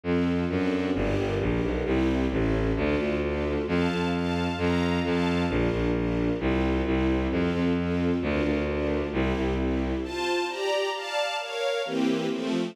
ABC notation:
X:1
M:2/4
L:1/8
Q:1/4=132
K:F
V:1 name="String Ensemble 1"
[CFA]2 [CD^FA]2 | [DGB]2 [DGB]2 | [CEG]2 [^CEA]2 | [DFA]2 [DFA]2 |
[cfa]2 [cfa]2 | [cfb]2 [cfa]2 | [DFB]2 [DFB]2 | [CFG]2 [CEG]2 |
[CFA]2 [CFA]2 | [DFB]2 [DFB]2 | [CEG]2 [CEG]2 | [Fca]2 [Gdb]2 |
[dfa]2 [B_df]2 | [E,B,CG]2 [F,A,C]2 |]
V:2 name="Violin" clef=bass
F,,2 ^F,,2 | G,,, G,,, B,,, =B,,, | C,,2 A,,,2 | D,, D,,3 |
F,, F,,3 | F,,2 F,,2 | B,,, B,,,3 | C,,2 C,,2 |
F,, F,,3 | D,, D,,3 | C,, C,,3 | z4 |
z4 | z4 |]